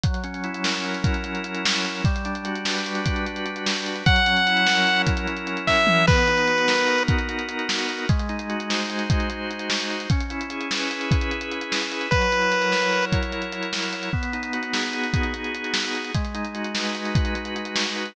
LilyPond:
<<
  \new Staff \with { instrumentName = "Lead 1 (square)" } { \time 5/8 \key b \major \tempo 4 = 149 r2 r8 | r2 r8 | r2 r8 | r2 r8 |
fis''2~ fis''8 | r4. e''4 | b'2~ b'8 | r2 r8 |
r2 r8 | r2 r8 | r2 r8 | r2 r8 |
b'2~ b'8 | r2 r8 | r2 r8 | r2 r8 |
r2 r8 | r2 r8 | }
  \new Staff \with { instrumentName = "Drawbar Organ" } { \time 5/8 \key b \major fis8 cis'8 e'8 ais'8 e'8 | cis'8 fis8 cis'8 e'8 ais'8 | g8 d'8 fis'8 b'8 fis'8 | d'8 g8 d'8 fis'8 b'8 |
fis8 cis'8 e'8 ais'8 e'8 | cis'8 fis8 cis'8 e'8 ais'8 | b8 dis'8 fis'8 ais'8 fis'8 | dis'8 b8 dis'8 fis'8 ais'8 |
gis8 dis'8 fis'8 bis'8 fis'8 | dis'8 gis8 dis'8 fis'8 bis'8 | cis'8 e'8 gis'8 b'8 gis'8 | e'8 cis'8 e'8 gis'8 b'8 |
fis8 e'8 ais'8 cis''8 ais'8 | e'8 fis8 e'8 ais'8 cis''8 | b8 dis'8 fis'8 gis'8 fis'8 | dis'8 b8 dis'8 fis'8 gis'8 |
gis8 dis'8 fis'8 b'8 fis'8 | dis'8 gis8 dis'8 fis'8 b'8 | }
  \new DrumStaff \with { instrumentName = "Drums" } \drummode { \time 5/8 <hh bd>16 hh16 hh16 hh16 hh16 hh16 sn16 hh16 hh16 hh16 | <hh bd>16 hh16 hh16 hh16 hh16 hh16 sn16 hh16 hh16 hh16 | <hh bd>16 hh16 hh16 hh16 hh16 hh16 sn16 hh16 hh16 hh16 | <hh bd>16 hh16 hh16 hh16 hh16 hh16 sn16 hh16 hh16 hh16 |
<hh bd>16 hh16 hh16 hh16 hh16 hh16 sn16 hh16 hh16 hh16 | <hh bd>16 hh16 hh16 hh16 hh16 hh16 <bd sn>8 toml8 | <cymc bd>16 hh16 hh16 hh16 hh16 hh16 sn16 hh16 hh16 hh16 | <hh bd>16 hh16 hh16 hh16 hh16 hh16 sn16 hh16 hh16 hh16 |
<hh bd>16 hh16 hh16 hh16 hh16 hh16 sn8 hh16 hh16 | <hh bd>16 hh16 hh8 hh16 hh16 sn16 hh16 hh16 hh16 | <hh bd>16 hh16 hh16 hh16 hh16 hh16 sn16 hh16 hh16 hh16 | <hh bd>16 hh16 hh16 hh16 hh16 hh16 sn16 hh16 hh16 hh16 |
<hh bd>16 hh16 hh16 hh16 hh16 hh16 sn16 hh16 hh16 hh16 | <hh bd>16 hh16 hh16 hh16 hh16 hh16 sn16 hh16 hh16 hh16 | bd16 hh16 hh16 hh16 hh16 hh16 sn16 hh16 hh16 hh16 | <hh bd>16 hh16 hh16 hh16 hh16 hh16 sn16 hh16 hh16 hh16 |
<hh bd>16 hh16 hh16 hh16 hh16 hh16 sn16 hh16 hh16 hh16 | <hh bd>16 hh16 hh16 hh16 hh16 hh16 sn16 hh16 hh16 hh16 | }
>>